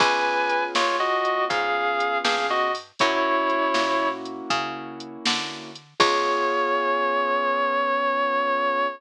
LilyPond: <<
  \new Staff \with { instrumentName = "Distortion Guitar" } { \time 12/8 \key des \major \tempo 4. = 80 <ces'' aes''>4. <f' des''>8 <ges' ees''>4 <aes' f''>4. <aes' f''>8 <ges' ees''>8 r8 | <fes' des''>2~ <fes' des''>8 r2. r8 | des''1. | }
  \new Staff \with { instrumentName = "Acoustic Grand Piano" } { \time 12/8 \key des \major <ces' des' f' aes'>1. | <bes des' fes' ges'>1. | <ces' des' f' aes'>1. | }
  \new Staff \with { instrumentName = "Electric Bass (finger)" } { \clef bass \time 12/8 \key des \major des,4. ees,4. aes,4. g,4. | ges,4. bes,4. des4. d4. | des,1. | }
  \new DrumStaff \with { instrumentName = "Drums" } \drummode { \time 12/8 <cymc bd>4 hh8 sn4 hh8 <hh bd>4 hh8 sn4 hho8 | <hh bd>4 hh8 sn4 hh8 <hh bd>4 hh8 sn4 hh8 | <cymc bd>4. r4. r4. r4. | }
>>